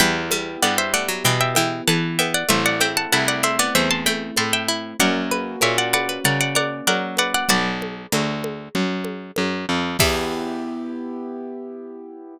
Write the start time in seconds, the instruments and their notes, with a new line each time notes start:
0.00 harpsichord E2 E3 E5 G5, acoustic grand piano B3 E4 G4, low conga
0.31 harpsichord G3, high conga
0.62 harpsichord G2 B3 D5 F#5, high conga
0.78 harpsichord C5 E5
0.94 harpsichord A3 D5 F#5
1.08 harpsichord F#3
1.24 harpsichord B2 E3 E5 G5, low conga
1.41 harpsichord E5 G5
1.55 harpsichord E3 E5 G5, high conga
1.88 harpsichord E3 B3 F#5 A5, high conga
2.19 harpsichord B3 E5 G5, high conga
2.34 harpsichord D5 F#5
2.49 harpsichord A1 A3 C5 E5, acoustic grand piano A3 C4 E4, low conga
2.66 harpsichord D5 F#5
2.80 harpsichord C4 E5 G5, high conga
2.97 harpsichord F#5 A5
3.12 harpsichord C2 E4 F#5 A5, high conga
3.28 harpsichord D5 F#5
3.43 harpsichord D4 C5 E5, high conga
3.59 harpsichord B3 D5 F#5
3.75 harpsichord E2 A3 C5 E5, low conga
3.91 harpsichord A5 C6
4.06 harpsichord A3 G5 B5, high conga
4.36 harpsichord A2 E4 A5 C6, high conga
4.53 harpsichord E5 G5
4.68 harpsichord E4
5.00 harpsichord F#2 A#4 D5 F#5, acoustic grand piano A#3 C#4 F#4, low conga
5.31 harpsichord B4, high conga
5.61 harpsichord A#2 A#4 C#5 E5, high conga
5.78 harpsichord D5 F#5
5.93 harpsichord B4 D5 F#5, high conga
6.09 harpsichord B4
6.24 harpsichord C#3 A#4 D5 F#5, low conga
6.41 harpsichord D5 F#5
6.55 harpsichord A#4 D5 F#5, high conga
6.87 harpsichord F#3 A#4 D5 F#5, high conga
7.17 harpsichord B4 D5 F#5, high conga
7.34 harpsichord D5 F#5
7.49 harpsichord B1 F#4 B4 D5, low conga
7.82 high conga
8.12 harpsichord D2 F#3, high conga
8.44 high conga
8.75 harpsichord F#2, low conga
9.05 high conga
9.36 harpsichord F#2, high conga
9.69 harpsichord F2
9.99 harpsichord E2 E3 E5, acoustic grand piano B3 E4 G4, kick, crash